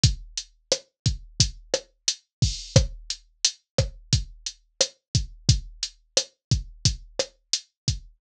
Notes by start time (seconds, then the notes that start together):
0.04 kick, closed hi-hat
0.37 closed hi-hat
0.72 cross-stick, closed hi-hat
1.06 kick, closed hi-hat
1.40 kick, closed hi-hat
1.74 cross-stick, closed hi-hat
2.08 closed hi-hat
2.42 kick, open hi-hat
2.76 kick, cross-stick, closed hi-hat
3.10 closed hi-hat
3.45 closed hi-hat
3.78 kick, cross-stick, closed hi-hat
4.13 kick, closed hi-hat
4.46 closed hi-hat
4.81 cross-stick, closed hi-hat
5.15 kick, closed hi-hat
5.49 kick, closed hi-hat
5.83 closed hi-hat
6.17 cross-stick, closed hi-hat
6.51 kick, closed hi-hat
6.85 kick, closed hi-hat
7.19 cross-stick, closed hi-hat
7.53 closed hi-hat
7.88 kick, closed hi-hat